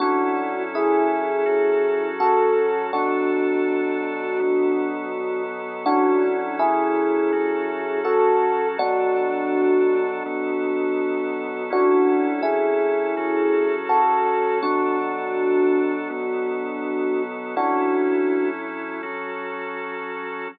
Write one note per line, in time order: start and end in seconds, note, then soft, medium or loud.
0.00 1.45 F#3 medium
0.00 1.45 C#4 medium
0.00 0.62 D4 medium
0.00 1.46 E4 medium
0.00 0.62 F#4 loud
0.00 1.45 A4 medium
0.75 2.08 E4 medium
0.75 2.08 G#4 medium
1.46 2.91 F#3 medium
1.46 2.91 C#4 medium
1.46 2.91 F#4 medium
1.46 2.91 A4 medium
2.20 2.86 F#4 medium
2.20 2.86 A4 medium
2.93 4.39 B2 medium
2.93 4.39 F#3 medium
2.93 5.43 D4 medium
2.93 4.39 D4 medium
2.93 5.43 F#4 medium
2.93 4.39 A4 loud
4.40 5.85 B2 medium
4.40 5.85 F#3 loud
4.40 5.85 B3 medium
4.40 5.85 A4 medium
5.86 7.32 F#3 loud
5.86 7.32 C#4 medium
5.86 6.57 D4 medium
5.86 7.32 E4 medium
5.86 6.57 F#4 loud
5.86 7.32 A4 medium
6.59 7.99 E4 medium
6.59 7.99 G#4 medium
7.32 8.77 F#3 medium
7.32 8.78 C#4 medium
7.32 8.78 F#4 medium
7.32 8.77 A4 medium
8.05 8.68 F#4 medium
8.05 8.68 A4 medium
8.78 10.23 B2 medium
8.78 10.23 F#3 loud
8.78 10.23 D4 medium
8.78 11.63 D4 medium
8.78 11.63 F#4 loud
8.78 10.23 A4 medium
10.26 11.71 B2 medium
10.26 11.70 F#3 medium
10.26 11.71 B3 medium
10.26 11.70 A4 medium
11.70 13.15 F#3 medium
11.70 13.15 C#4 medium
11.70 12.42 D4 medium
11.70 13.15 E4 medium
11.70 12.42 F#4 loud
11.70 13.15 A4 medium
12.43 13.74 E4 medium
12.43 13.74 G#4 medium
13.17 14.62 F#3 medium
13.17 14.62 C#4 medium
13.17 14.62 F#4 medium
13.17 14.62 A4 loud
13.89 14.59 F#4 medium
13.89 14.59 A4 medium
14.63 16.08 B2 medium
14.63 16.08 F#3 loud
14.63 17.22 D4 medium
14.63 16.08 D4 medium
14.63 17.22 F#4 medium
14.63 16.08 A4 medium
16.10 17.55 B2 medium
16.10 17.55 F#3 medium
16.10 17.55 B3 medium
16.10 17.55 A4 medium
17.56 19.02 F#3 medium
17.56 19.02 C#4 medium
17.56 18.48 D4 medium
17.56 19.02 E4 loud
17.56 18.48 F#4 loud
17.56 19.02 A4 medium
19.03 20.48 F#3 medium
19.03 20.48 C#4 medium
19.03 20.48 F#4 medium
19.03 20.48 A4 medium